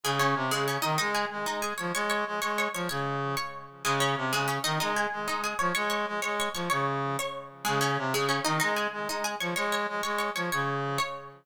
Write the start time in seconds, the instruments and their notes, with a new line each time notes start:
0.04 brass section C#3, pizzicato strings G#3 G#4
0.19 pizzicato strings C#4 C#5
0.35 brass section C3
0.51 brass section C#3, pizzicato strings G#3 G#4
0.68 pizzicato strings C#4 C#5
0.82 brass section D#3, pizzicato strings D#4 D#5
0.98 brass section G#3, pizzicato strings D#4 D#5
1.15 pizzicato strings G#4 G#5
1.31 brass section G#3
1.46 brass section G#3, pizzicato strings D#4 D#5
1.62 pizzicato strings G#4 G#5
1.78 brass section F3, pizzicato strings C#5 C#6
1.94 brass section G#3, pizzicato strings C#5 C#6
2.10 pizzicato strings C#5 C#6
2.26 brass section G#3
2.42 brass section G#3, pizzicato strings C#5 C#6
2.58 pizzicato strings C#5 C#6
2.74 brass section F3, pizzicato strings C#5 C#6
2.89 brass section C#3, pizzicato strings C#5 C#6
3.37 pizzicato strings C#5 C#6
3.84 brass section C#3, pizzicato strings G#3 G#4
4.00 pizzicato strings C#4 C#5
4.16 brass section C3
4.32 brass section C#3, pizzicato strings G#3 G#4
4.48 pizzicato strings C#4 C#5
4.64 brass section D#3, pizzicato strings D#4 D#5
4.80 brass section G#3, pizzicato strings D#4 D#5
4.96 pizzicato strings G#4 G#5
5.12 brass section G#3
5.28 brass section G#3, pizzicato strings D#4 D#5
5.44 pizzicato strings G#4 G#5
5.59 brass section F3, pizzicato strings C#5 C#6
5.75 brass section G#3, pizzicato strings C#5 C#6
5.90 pizzicato strings C#5 C#6
6.07 brass section G#3
6.22 brass section G#3, pizzicato strings C#5 C#6
6.40 pizzicato strings C#5 C#6
6.54 brass section F3, pizzicato strings C#5 C#6
6.70 brass section C#3, pizzicato strings C#5 C#6
7.19 pizzicato strings C#5 C#6
7.65 brass section C#3, pizzicato strings G#3 G#4
7.81 pizzicato strings C#4 C#5
7.98 brass section C3
8.13 brass section C#3, pizzicato strings G#3 G#4
8.29 pizzicato strings C#4 C#5
8.45 brass section D#3, pizzicato strings D#4 D#5
8.60 brass section G#3, pizzicato strings D#4 D#5
8.76 pizzicato strings G#4 G#5
8.92 brass section G#3
9.08 brass section G#3, pizzicato strings D#4 D#5
9.24 pizzicato strings G#4 G#5
9.40 brass section F3, pizzicato strings C#5 C#6
9.56 brass section G#3, pizzicato strings C#5 C#6
9.72 pizzicato strings C#5 C#6
9.88 brass section G#3
10.03 brass section G#3, pizzicato strings C#5 C#6
10.18 pizzicato strings C#5 C#6
10.35 brass section F3, pizzicato strings C#5 C#6
10.52 brass section C#3, pizzicato strings C#5 C#6
10.98 pizzicato strings C#5 C#6